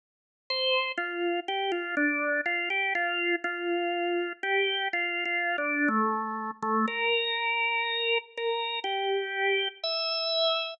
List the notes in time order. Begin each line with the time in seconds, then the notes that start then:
0.50 C5
0.98 F4
1.48 G4
1.72 F4
1.97 D4
2.46 F4
2.70 G4
2.95 F4
3.44 F4
4.43 G4
4.93 F4
5.25 F4
5.58 D4
5.88 A3
6.63 A3
6.88 A#4
8.38 A#4
8.84 G4
9.84 E5